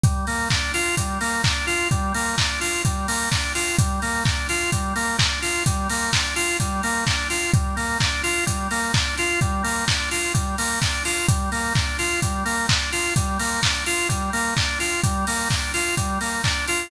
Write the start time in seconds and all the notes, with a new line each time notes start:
0.04 G3, kick, closed hi-hat
0.27 A#3, open hi-hat
0.50 D4, kick, clap
0.74 F4, open hi-hat
0.97 G3, kick, closed hi-hat
1.21 A#3, open hi-hat
1.44 D4, kick, clap
1.67 F4, open hi-hat
1.91 G3, kick, closed hi-hat
2.14 A#3, open hi-hat
2.38 D4, kick, clap
2.61 F4, open hi-hat
2.85 G3, kick, closed hi-hat
3.08 A#3, open hi-hat
3.31 D4, kick, clap
3.55 F4, open hi-hat
3.79 G3, kick, closed hi-hat
4.02 A#3, open hi-hat
4.25 D4, kick, clap
4.49 F4, open hi-hat
4.72 G3, kick, closed hi-hat
4.96 A#3, open hi-hat
5.18 D4, kick, clap
5.42 F4, open hi-hat
5.66 G3, kick, closed hi-hat
5.90 A#3, open hi-hat
6.13 D4, kick, clap
6.36 F4, open hi-hat
6.60 G3, kick, closed hi-hat
6.83 A#3, open hi-hat
7.07 D4, kick, clap
7.30 F4, open hi-hat
7.54 G3, kick, closed hi-hat
7.76 A#3, open hi-hat
8.00 D4, kick, clap
8.23 F4, open hi-hat
8.46 G3, kick, closed hi-hat
8.71 A#3, open hi-hat
8.94 D4, kick, clap
9.18 F4, open hi-hat
9.41 G3, kick, closed hi-hat
9.64 A#3, open hi-hat
9.88 D4, kick, clap
10.11 F4, open hi-hat
10.34 G3, kick, closed hi-hat
10.58 A#3, open hi-hat
10.82 D4, kick, clap
11.05 F4, open hi-hat
11.28 G3, kick, closed hi-hat
11.52 A#3, open hi-hat
11.75 D4, kick, clap
11.99 F4, open hi-hat
12.22 G3, kick, closed hi-hat
12.45 A#3, open hi-hat
12.69 D4, kick, clap
12.92 F4, open hi-hat
13.16 G3, kick, closed hi-hat
13.39 A#3, open hi-hat
13.62 D4, kick, clap
13.86 F4, open hi-hat
14.09 G3, kick, closed hi-hat
14.33 A#3, open hi-hat
14.57 D4, kick, clap
14.80 F4, open hi-hat
15.04 G3, kick, closed hi-hat
15.27 A#3, open hi-hat
15.50 D4, kick, clap
15.74 F4, open hi-hat
15.97 G3, kick, closed hi-hat
16.21 A#3, open hi-hat
16.44 D4, kick, clap
16.68 F4, open hi-hat